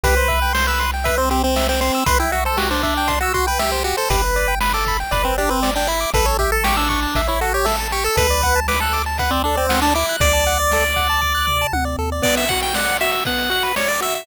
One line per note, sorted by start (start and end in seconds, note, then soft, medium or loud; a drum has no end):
0.03 1.91 C2 loud
0.03 0.15 G4 medium
0.03 0.53 B4 medium
0.03 kick medium
0.03 closed hi-hat loud
0.17 0.28 C5 medium
0.28 0.40 E5 medium
0.28 kick medium
0.28 closed hi-hat medium
0.42 0.53 G5 medium
0.53 0.67 C5 medium
0.53 0.65 C6 medium
0.53 snare loud
0.67 0.91 B4 medium
0.67 0.79 E6 medium
0.80 0.91 C6 medium
0.80 closed hi-hat medium
0.94 1.05 G5 medium
1.04 1.17 B4 medium
1.04 1.16 E5 medium
1.04 kick medium
1.04 closed hi-hat loud
1.17 1.29 C4 medium
1.17 1.29 C5 medium
1.30 1.43 C4 medium
1.30 1.42 G4 medium
1.30 closed hi-hat medium
1.43 1.67 C4 medium
1.43 1.55 C5 medium
1.56 1.68 E5 medium
1.56 snare loud
1.69 1.80 C4 medium
1.69 1.81 G5 medium
1.81 2.04 C4 medium
1.81 1.92 C6 medium
1.81 closed hi-hat medium
1.94 2.06 E6 medium
2.06 3.94 C2 medium
2.06 2.18 B4 medium
2.06 2.18 C6 medium
2.06 kick loud
2.06 closed hi-hat loud
2.19 2.32 E4 medium
2.19 2.31 G5 medium
2.32 2.44 F#4 medium
2.32 2.44 E5 medium
2.32 closed hi-hat medium
2.45 2.58 A4 medium
2.45 2.57 C5 medium
2.57 2.70 F#4 medium
2.57 2.68 G4 medium
2.57 snare loud
2.71 2.83 D4 medium
2.71 2.82 C5 medium
2.83 3.19 D4 medium
2.83 2.94 E5 medium
2.83 kick medium
2.83 closed hi-hat medium
2.97 3.09 G5 medium
3.08 3.19 C6 medium
3.08 kick medium
3.08 closed hi-hat loud
3.21 3.33 F#4 medium
3.21 3.34 E6 medium
3.34 3.46 F#4 medium
3.34 3.45 C6 medium
3.34 kick medium
3.34 closed hi-hat medium
3.47 3.60 B4 medium
3.47 3.58 G5 medium
3.59 3.83 G4 medium
3.59 3.71 E5 medium
3.59 snare medium
3.72 3.83 C5 medium
3.84 3.96 F#4 medium
3.84 3.96 G4 medium
3.84 closed hi-hat medium
3.97 4.10 A4 medium
3.97 4.09 C5 medium
4.10 5.04 G1 loud
4.10 4.22 G4 medium
4.10 4.55 B4 medium
4.10 kick loud
4.10 closed hi-hat loud
4.24 4.35 B4 medium
4.36 4.47 D5 medium
4.36 closed hi-hat medium
4.48 4.59 G5 medium
4.60 4.72 B4 medium
4.60 4.73 B5 medium
4.60 snare loud
4.73 4.97 A4 medium
4.73 4.85 D6 medium
4.86 4.99 B5 medium
4.86 kick medium
4.86 closed hi-hat medium
5.00 5.11 G5 medium
5.11 6.06 G1 medium
5.11 5.24 B4 medium
5.11 5.23 D5 medium
5.11 kick medium
5.11 closed hi-hat loud
5.24 5.37 C4 medium
5.24 5.35 B4 medium
5.38 5.50 D4 medium
5.38 5.50 G4 medium
5.38 closed hi-hat medium
5.49 5.71 C4 medium
5.49 5.60 B4 medium
5.63 5.74 D5 medium
5.63 snare loud
5.75 5.88 D4 medium
5.75 5.88 G5 medium
5.87 6.10 E4 medium
5.87 6.00 B5 medium
5.87 closed hi-hat medium
6.01 6.12 D6 medium
6.14 7.07 A1 loud
6.14 6.25 A4 loud
6.14 6.26 B4 medium
6.14 kick loud
6.14 closed hi-hat loud
6.25 6.37 A4 medium
6.25 6.37 C#5 medium
6.39 6.51 G4 medium
6.39 6.51 E5 medium
6.39 kick medium
6.39 closed hi-hat medium
6.52 6.64 A4 medium
6.52 6.63 A5 medium
6.64 6.76 G4 medium
6.64 6.75 C#6 medium
6.64 snare loud
6.76 6.89 D4 medium
6.76 6.88 E6 medium
6.89 7.22 D4 medium
6.89 7.00 C#6 medium
6.89 kick medium
6.89 closed hi-hat medium
7.03 7.14 A5 medium
7.15 8.09 A1 medium
7.15 7.28 E5 medium
7.15 kick medium
7.15 closed hi-hat loud
7.27 7.40 E4 medium
7.27 7.39 C#5 medium
7.41 7.53 F#4 medium
7.41 7.52 A4 medium
7.41 closed hi-hat medium
7.54 7.66 G4 medium
7.54 7.66 C#5 medium
7.65 7.88 A4 medium
7.65 7.76 E5 medium
7.65 snare loud
7.80 7.92 A5 medium
7.91 8.04 G4 medium
7.91 8.04 C#6 medium
7.91 closed hi-hat medium
8.04 8.16 A4 medium
8.04 8.17 E6 medium
8.16 10.04 D2 loud
8.16 8.27 A4 medium
8.16 8.60 B4 medium
8.16 kick loud
8.16 closed hi-hat loud
8.30 8.42 D5 medium
8.42 8.55 F#5 medium
8.42 kick medium
8.42 closed hi-hat medium
8.56 8.67 A5 medium
8.68 8.80 B4 medium
8.68 8.79 D6 medium
8.68 snare loud
8.80 9.02 A4 medium
8.80 8.93 F#6 medium
8.93 9.04 D6 medium
8.93 closed hi-hat medium
9.06 9.18 A5 medium
9.18 9.31 B4 medium
9.18 9.31 F#5 medium
9.18 kick medium
9.18 closed hi-hat medium
9.31 9.43 C4 medium
9.31 9.42 D5 medium
9.44 9.56 D4 medium
9.44 9.57 A4 medium
9.55 9.80 C4 medium
9.55 9.67 D5 medium
9.69 9.81 F#5 medium
9.69 snare loud
9.69 closed hi-hat medium
9.82 9.94 D4 medium
9.82 9.94 A5 medium
9.94 10.16 E4 medium
9.94 10.06 D6 medium
9.94 closed hi-hat medium
10.09 10.20 F#6 medium
10.20 11.65 D2 medium
10.20 11.67 D5 medium
10.20 10.33 D6 medium
10.20 kick loud
10.20 closed hi-hat loud
10.33 10.45 A5 medium
10.46 10.58 F#5 medium
10.46 closed hi-hat medium
10.60 10.71 D5 medium
10.71 10.84 A4 medium
10.71 snare medium
10.82 10.94 D5 medium
10.96 11.08 F#5 medium
10.96 kick medium
10.96 closed hi-hat medium
11.09 11.21 A5 medium
11.22 11.33 D6 medium
11.22 kick medium
11.35 11.46 F#6 medium
11.47 11.58 D6 medium
11.47 floor tom medium
11.61 11.73 A5 medium
11.73 11.96 D2 medium
11.73 11.85 F#5 medium
11.73 high tom medium
11.85 11.96 D5 medium
11.98 12.21 D#2 medium
11.98 12.10 A4 medium
12.12 12.23 D5 medium
12.22 12.45 B3 medium
12.22 12.35 D5 medium
12.22 kick medium
12.22 crash loud
12.37 12.49 E5 medium
12.37 closed hi-hat medium
12.49 12.73 F#4 medium
12.49 12.61 F#5 medium
12.49 kick medium
12.49 closed hi-hat medium
12.62 12.75 G5 medium
12.62 closed hi-hat medium
12.74 12.98 D5 medium
12.74 12.97 F#5 medium
12.74 snare loud
12.87 closed hi-hat medium
13.01 13.24 F#4 medium
13.01 13.11 E5 medium
13.01 closed hi-hat medium
13.12 13.24 E5 medium
13.12 closed hi-hat medium
13.25 13.49 B3 medium
13.25 13.51 F#5 medium
13.25 kick medium
13.25 closed hi-hat medium
13.38 closed hi-hat medium
13.50 13.73 F#4 medium
13.50 13.63 F#5 medium
13.50 closed hi-hat medium
13.63 13.75 B4 medium
13.63 closed hi-hat medium
13.76 13.88 C#5 medium
13.76 13.99 D5 medium
13.76 snare loud
13.88 14.00 D5 medium
13.88 closed hi-hat medium
14.01 14.24 F#4 medium
14.01 14.14 E5 medium
14.01 closed hi-hat medium
14.14 14.26 E5 medium
14.14 closed hi-hat medium